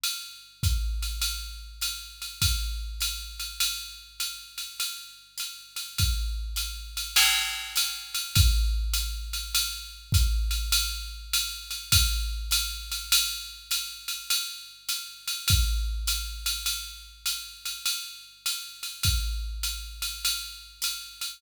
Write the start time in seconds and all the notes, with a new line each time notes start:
0.04 ride
0.63 kick, hi-hat pedal, ride
1.02 ride
1.22 ride
1.81 hi-hat pedal, ride
2.22 ride
2.42 kick, ride
3.00 hi-hat pedal, ride
3.40 ride
3.60 ride
4.20 hi-hat pedal, ride
4.58 ride
4.80 ride
5.38 hi-hat pedal, ride
5.76 ride
5.98 kick, ride
6.56 hi-hat pedal, ride
6.97 ride
7.16 crash, ride
7.76 hi-hat pedal, ride
8.15 ride
8.36 kick, ride
8.94 hi-hat pedal, ride
9.33 ride
9.55 ride
10.12 kick, hi-hat pedal, ride
10.51 ride
10.72 ride
11.33 hi-hat pedal, ride
11.71 ride
11.92 kick, ride
12.51 hi-hat pedal, ride
12.92 ride
13.12 ride
13.71 hi-hat pedal, ride
14.08 ride
14.30 ride
14.89 hi-hat pedal, ride
15.28 ride
15.48 kick, ride
16.07 hi-hat pedal, ride
16.46 ride
16.66 ride
17.26 hi-hat pedal, ride
17.65 ride
17.86 ride
18.46 hi-hat pedal, ride
18.83 ride
19.03 kick, ride
19.63 hi-hat pedal, ride
20.02 ride
20.25 ride
20.82 hi-hat pedal, ride
21.21 ride